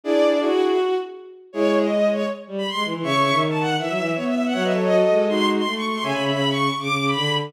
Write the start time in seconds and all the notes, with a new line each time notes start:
0.04 D4 E4 G#4 D5
0.40 E4 F#4 G#4
1.53 G#3 E4 G#4 C#5
1.82 D#5
2.10 C#5
2.48 G3
2.58 B5
2.67 C6
2.74 G#3
2.85 E3
2.94 E3
3.02 C#3 C#5 E5 C#6
3.12 C#3
3.22 C#3
3.32 D#3
3.50 A5
3.60 F#5
3.79 E3 E5
3.89 F#3
3.98 E3
4.15 B3 C#5
4.25 E5
4.35 E5
4.45 F#5
4.53 F#3 C#5 E5 F#5
4.63 B4 D#5 E5
4.73 A4 C#5
4.82 D#5
4.91 F#4 A4
5.10 G#3
5.28 D#4 F#4 C6
5.57 C6
5.65 A3
5.76 C#6
5.85 C#6
5.95 C6
6.03 C#3 C#5 E5 G#5
6.13 C#3 B5
6.22 C#3 B5
6.32 C#3 B5
6.50 C#6
6.69 C#6
6.79 C#3 D6
6.88 C#3
6.98 C#3
7.07 B5
7.16 D3